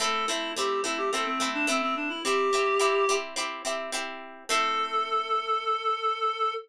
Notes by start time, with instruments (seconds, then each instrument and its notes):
0.00 acoustic guitar (steel) A3 C4 E4, clarinet A4
0.28 acoustic guitar (steel) A3 C4 E4, clarinet E4
0.56 acoustic guitar (steel) A3 C4 E4, clarinet G4
0.84 acoustic guitar (steel) A3 C4 E4, clarinet E4
0.98 clarinet G4
1.12 acoustic guitar (steel) A3 C4 E4, clarinet A4
1.25 clarinet C4
1.40 acoustic guitar (steel) A3 C4 E4
1.54 clarinet D4
1.67 acoustic guitar (steel) A3 C4 E4, clarinet C4
1.82 clarinet C4
1.96 clarinet D4
2.09 clarinet E4
2.24 acoustic guitar (steel) C4 E4 G4, clarinet G4
2.53 acoustic guitar (steel) C4 E4 G4
2.79 acoustic guitar (steel) C4 E4 G4
3.09 acoustic guitar (steel) C4 E4 G4
3.36 acoustic guitar (steel) C4 E4 G4
3.65 acoustic guitar (steel) C4 E4 G4
3.92 acoustic guitar (steel) C4 E4 G4
4.49 acoustic guitar (steel) A3 C4 E4, clarinet A4